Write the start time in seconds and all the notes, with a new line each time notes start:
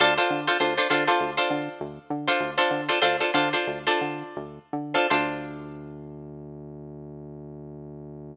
0.00 D2 D4 F4 A4 C5
0.18 D4 F4 A4 C5
0.30 D3
0.47 D4 F4 A4 C5
0.60 D2 D4 F4 A4 C5
0.78 D4 F4 A4 C5
0.90 D3 D4 F4 A4 C5
1.07 D4 F4 A4 C5
1.20 D2
1.37 D4 F4 A4 C5
1.50 D3
1.80 D2
2.10 D3
2.27 D4 F4 A4 C5
2.40 D2
2.58 D4 F4 A4 C5
2.71 D3
2.89 D4 F4 A4 C5
3.02 D2 D4 F4 A4 C5
3.20 D4 F4 A4 C5
3.34 D3 D4 F4 A4 C5
3.53 D4 F4 A4 C5
3.67 D2
3.87 D4 F4 A4 C5
4.01 D3
4.37 D2
4.73 D3
4.94 D4 F4 A4 C5
5.10 D2 D4 F4 A4 C5